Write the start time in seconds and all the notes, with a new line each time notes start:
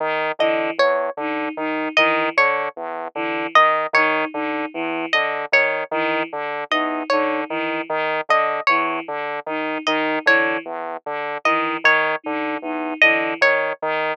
0.00 D#3
0.39 D3 E3 D#5
0.78 E2 C#5
1.17 D3 D#4
1.57 D#3 D#4
1.97 D#3 E3 D#5
2.37 D3 C#5
2.76 E2
3.15 D3 E3
3.55 D#3 D#5
3.93 D#3 D#4 C#5
4.34 D3 D#4
4.74 E2 E3
5.13 D3 D#5
5.52 D#3 C#5
5.91 D#3 E3
6.33 D3
6.71 E2 D#4 D#5
7.10 D3 D#4 C#5
7.49 D#3 E3
7.89 D#3
8.29 D3 D#5
8.67 E2 E3 C#5
9.08 D3
9.46 D#3 D#4
9.86 D#3 D#4 D#5
10.26 D3 E3 C#5
10.65 E2
11.06 D3
11.45 D#3 E3 D#5
11.84 D#3 C#5
12.24 D3 D#4
12.62 E2 D#4
13.01 D3 E3 D#5
13.41 D#3 C#5
13.82 D#3